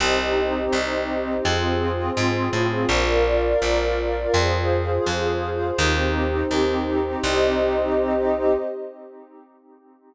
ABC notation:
X:1
M:2/4
L:1/8
Q:1/4=83
K:Cm
V:1 name="Pad 5 (bowed)"
[CEG]4 | [CFA]4 | [Bdf]4 | [Acf]4 |
[CEG]4 | [CEG]4 |]
V:2 name="Pad 2 (warm)"
[Gce]4 | [FAc]4 | [FBd]4 | [FAc]4 |
[EGc]4 | [Gce]4 |]
V:3 name="Electric Bass (finger)" clef=bass
C,,2 C,,2 | F,,2 A,, =A,, | B,,,2 B,,,2 | F,,2 F,,2 |
E,,2 E,,2 | C,,4 |]